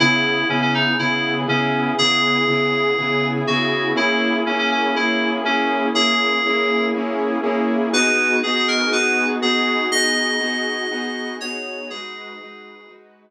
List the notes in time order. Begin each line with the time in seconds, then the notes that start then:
0.00 C#3 B3 E4 G#4
0.49 C#3 B3 C#4 E4 G#4
0.62 C#4
0.74 D#4
0.99 C#3 B3 E4 G#4
1.47 C#3 B3 C#4 E4 G#4
1.98 C#3 B3 E4 G#4
2.47 C#3 B3 E4 G#4
2.98 C#3 B3 E4 G#4
3.47 C#3 B3 E4 F#4 G#4
3.95 A#3 C#4 E4 G#4
4.46 A#3 C#4 E4 G#4
4.59 C#4
4.71 C#4
4.95 A#3 C#4 E4 G#4
5.45 A#3 C#4 E4 G#4
5.94 A#3 C#4 E4 G#4
6.46 A#3 C#4 E4 G#4
6.94 A#3 C#4 E4 G#4
7.43 A#3 C#4 E4 G#4
7.93 B3 D#4 F#4 G#4 B4
8.43 B3 D#4 F#4 G#4
8.55 G#4
8.68 A#4
8.91 B3 D#4 F#4 G#4 B4
9.42 B3 D#4 F#4 G#4
9.92 B3 D#4 F#4 G#4 D#5
10.40 B3 D#4 F#4 G#4
10.91 B3 D#4 F#4 G#4
11.40 B3 D#4 F#4 G#4 C#5
11.90 G#3 D#4 F#4 G#4 B4
12.40 G#3 D#4 F#4 B4
12.88 G#3 D#4 F#4 B4